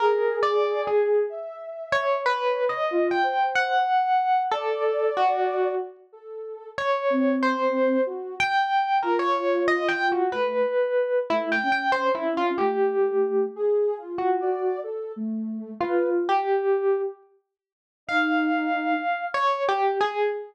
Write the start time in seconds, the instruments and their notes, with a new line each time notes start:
0.00 ocarina G#4, electric piano 1 A#4
0.43 electric piano 1 D5
0.87 electric piano 1 G#4
1.29 ocarina E5
1.92 electric piano 1 C#5
2.26 electric piano 1 B4, ocarina C#5
2.69 electric piano 1 D#5
2.91 ocarina F4
3.11 electric piano 1 G5
3.23 ocarina C5
3.55 electric piano 1 F#5
4.51 electric piano 1 A4, ocarina D5
5.17 electric piano 1 F#4
6.12 ocarina A4
6.77 ocarina C#5, electric piano 1 C#5
7.10 ocarina C4
7.43 electric piano 1 C5
8.06 ocarina F#4
8.40 electric piano 1 G5
9.03 ocarina F4, electric piano 1 A#4
9.19 electric piano 1 C#5
9.68 electric piano 1 D#5
9.88 electric piano 1 G5
10.12 electric piano 1 F#4
10.32 ocarina A3, electric piano 1 B4
11.30 ocarina A3, electric piano 1 E4
11.52 electric piano 1 G5
11.63 ocarina C#4
11.72 electric piano 1 G5
11.92 electric piano 1 C5
12.15 electric piano 1 E4
12.37 electric piano 1 F4
12.58 ocarina A3, electric piano 1 G4
13.56 ocarina G#4
13.98 ocarina F4
14.18 electric piano 1 F#4
14.40 ocarina D5
14.83 ocarina A4
15.16 ocarina A3
15.81 electric piano 1 F4, ocarina B4
16.29 electric piano 1 G4
18.07 ocarina D#4, electric piano 1 F5
19.34 electric piano 1 C#5
19.69 electric piano 1 G4
20.01 electric piano 1 G#4